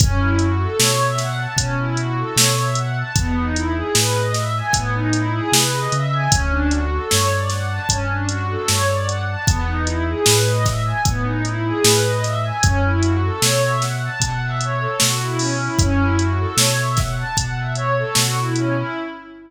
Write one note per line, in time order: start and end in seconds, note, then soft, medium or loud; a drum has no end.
0.00 0.67 F#2 medium
0.00 0.19 C#4 loud
0.00 kick loud
0.00 closed hi-hat loud
0.18 0.36 E4 medium
0.39 0.57 F#4 medium
0.39 closed hi-hat medium
0.60 0.77 A4 medium
0.79 1.47 B2 medium
0.79 0.97 C#5 loud
0.79 snare loud
0.99 1.17 E5 medium
1.18 1.36 F#5 loud
1.18 snare soft
1.18 closed hi-hat medium
1.38 1.55 A5 medium
1.56 2.24 B2 medium
1.56 1.75 C#4 medium
1.56 kick medium
1.56 closed hi-hat loud
1.78 1.96 E4 medium
1.97 2.14 F#4 medium
1.97 closed hi-hat medium
2.17 2.35 A4 medium
2.36 3.03 B2 medium
2.36 2.55 C#5 medium
2.36 snare loud
2.57 2.75 E5 medium
2.75 2.94 F#5 medium
2.75 closed hi-hat medium
2.97 3.15 A5 medium
3.16 3.83 E2 medium
3.16 3.35 B3 loud
3.16 kick medium
3.16 closed hi-hat medium
3.36 3.53 D#4 medium
3.54 3.72 E4 medium
3.54 closed hi-hat medium
3.75 3.92 G#4 medium
3.95 4.62 A2 medium
3.95 4.13 B4 medium
3.95 snare loud
4.13 4.31 D#5 medium
4.34 4.53 E5 loud
4.34 snare medium
4.34 closed hi-hat medium
4.56 4.74 G#5 medium
4.73 5.41 A2 medium
4.73 4.91 B3 loud
4.73 kick medium
4.73 closed hi-hat loud
4.94 5.12 D#4 medium
5.13 5.32 E4 medium
5.13 closed hi-hat medium
5.34 5.51 G#4 loud
5.52 5.88 C3 medium
5.52 5.72 B4 medium
5.52 snare loud
5.72 5.89 D#5 medium
5.92 6.28 C#3 medium
5.92 6.10 E5 loud
5.92 closed hi-hat medium
6.12 6.30 G#5 medium
6.31 6.99 D2 medium
6.31 6.49 C#4 loud
6.31 kick loud
6.31 closed hi-hat loud
6.50 6.68 D4 loud
6.70 6.88 F#4 medium
6.70 closed hi-hat medium
6.92 7.09 A4 medium
7.10 7.79 G2 medium
7.10 7.28 C#5 loud
7.10 snare medium
7.31 7.49 D5 medium
7.50 7.68 F#5 medium
7.50 snare soft
7.50 closed hi-hat medium
7.68 7.86 A5 medium
7.88 8.57 G2 medium
7.88 8.06 C#4 medium
7.88 kick medium
7.88 closed hi-hat loud
8.09 8.27 D4 medium
8.28 8.45 F#4 loud
8.28 closed hi-hat medium
8.48 8.66 A4 medium
8.68 9.36 G2 medium
8.68 8.86 C#5 medium
8.68 snare medium
8.88 9.05 D5 medium
9.06 9.24 F#5 medium
9.06 closed hi-hat medium
9.27 9.45 A5 medium
9.47 10.14 E2 medium
9.47 9.65 B3 loud
9.47 kick loud
9.47 closed hi-hat medium
9.67 9.85 D#4 medium
9.85 10.03 E4 medium
9.85 closed hi-hat medium
10.07 10.25 G#4 medium
10.25 10.93 A2 medium
10.25 10.43 B4 loud
10.25 snare loud
10.47 10.64 D#5 medium
10.64 10.82 E5 medium
10.64 kick medium
10.64 snare medium
10.64 closed hi-hat medium
10.84 11.02 G#5 medium
11.05 11.72 A2 medium
11.05 11.24 B3 medium
11.05 kick medium
11.05 closed hi-hat medium
11.24 11.41 D#4 medium
11.44 11.61 E4 medium
11.44 closed hi-hat medium
11.65 11.83 G#4 loud
11.84 12.52 A2 medium
11.84 12.02 B4 loud
11.84 snare loud
12.04 12.22 D#5 medium
12.24 12.42 E5 medium
12.24 snare soft
12.24 closed hi-hat medium
12.44 12.62 G#5 medium
12.62 13.30 F#2 medium
12.62 12.80 C#4 loud
12.62 kick medium
12.62 closed hi-hat medium
12.83 13.01 E4 medium
13.01 13.19 F#4 medium
13.01 closed hi-hat medium
13.22 13.40 A4 medium
13.42 14.09 B2 medium
13.42 13.60 C#5 loud
13.42 snare loud
13.62 13.79 E5 medium
13.81 13.98 F#5 medium
13.81 snare medium
13.81 closed hi-hat medium
14.03 14.21 A5 loud
14.20 14.87 B2 medium
14.20 14.39 F#5 loud
14.20 kick medium
14.20 closed hi-hat medium
14.40 14.58 E5 medium
14.61 14.80 C#5 medium
14.61 closed hi-hat medium
14.79 14.97 A4 medium
15.00 15.69 B2 medium
15.00 15.19 F#4 loud
15.00 snare loud
15.19 15.37 E4 medium
15.38 15.56 C#4 medium
15.38 open hi-hat medium
15.59 15.76 E4 medium
15.79 16.46 F#2 medium
15.79 15.99 C#4 loud
15.79 kick medium
15.79 closed hi-hat medium
15.98 16.16 E4 medium
16.18 16.36 F#4 medium
16.18 closed hi-hat medium
16.38 16.56 A4 medium
16.57 17.24 B2 medium
16.57 16.75 C#5 medium
16.57 snare loud
16.76 16.94 E5 medium
16.97 17.15 F#5 medium
16.97 kick medium
16.97 snare medium
16.97 closed hi-hat medium
17.16 17.34 A5 loud
17.37 18.04 B2 medium
17.37 17.55 F#5 loud
17.37 kick medium
17.37 closed hi-hat loud
17.57 17.75 E5 medium
17.75 17.93 C#5 medium
17.75 closed hi-hat medium
17.97 18.14 A4 medium
18.15 18.83 B2 medium
18.15 18.34 F#4 loud
18.15 snare loud
18.36 18.54 E4 medium
18.55 18.73 C#4 medium
18.55 closed hi-hat medium
18.75 18.93 E4 medium